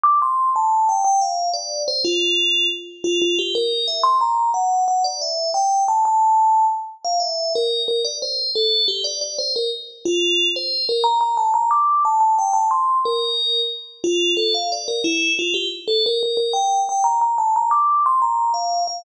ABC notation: X:1
M:6/8
L:1/8
Q:3/8=120
K:F
V:1 name="Tubular Bells"
d' c'2 a2 g | g f2 d2 c | F4 z2 | F F G B2 e |
c' b2 ^f2 f | d e2 g2 a | a4 z2 | f e2 B2 B |
d c2 A2 G | d d c B z2 | F3 c2 B | b b a b d'2 |
a a g a c'2 | B4 z2 | F2 A f d B | E2 F G z A |
B B B g2 g | b b a b d'2 | c' b2 f2 f |]